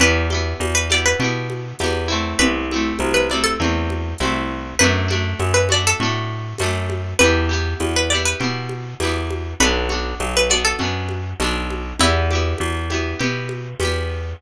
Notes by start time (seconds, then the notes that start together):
0.00 E2 B3 E4 G4 B4, low conga
0.30 E4 G4, high conga
0.34 B3
0.60 E2, tambourine, high conga
0.75 B4
0.90 B3 E4 G4 D5, high conga
1.06 B4
1.19 B2 E4 G4, low conga
1.24 B3
1.50 high conga
1.79 E2 E4 G4, tambourine, high conga
1.84 B3
2.08 A3 C4 E4
2.39 C2 B4, low conga
2.71 C4 E4, high conga
2.76 A3
2.99 C2, tambourine, high conga
3.14 B4
3.30 C4 E4 D5, high conga
3.34 A3
3.44 A4
3.60 E2 A3 C4 E4, low conga
3.90 high conga
4.18 C2 C4 E4, tambourine, high conga
4.24 A3
4.79 F#2 D4 F#4 B4, low conga
4.84 A3
5.08 A3 D4 F#4, high conga
5.40 F#2, tambourine, high conga
5.54 B4
5.69 D4 F#4 D5, high conga
5.73 A3
5.87 A4
6.00 A2 D4 F#4, low conga
6.05 A3
6.58 F#2 D4 F#4, tambourine, high conga
6.63 A3
6.90 high conga
7.19 E2 E4 G4 B4, low conga
7.24 B3
7.49 B3 E4 G4
7.80 E2, tambourine, high conga
7.96 B4
8.10 E4 G4 D5
8.14 B3
8.25 B4
8.40 B2 B3 E4 G4, low conga
8.69 high conga
9.00 E2 E4 G4, tambourine, high conga
9.05 B3
9.30 high conga
9.60 B1 B3 D4 F#4 B4, low conga
9.89 D4 F#4, high conga
9.94 B3
10.20 B1, tambourine, high conga
10.37 B4
10.50 B3 D4 F#4 D5, high conga
10.65 A4
10.79 F#2 D4 F#4, low conga
10.83 B3
11.09 high conga
11.40 B1 B3 D4 F#4, tambourine, high conga
11.70 high conga
11.99 E2 B3 E4 G4, low conga
12.31 E4 G4, high conga
12.35 B3
12.58 E2, tambourine, high conga
12.90 B3 E4 G4, high conga
13.19 B2 B3 E4 G4, low conga
13.49 high conga
13.80 E2 E4 G4, tambourine, high conga
13.85 B3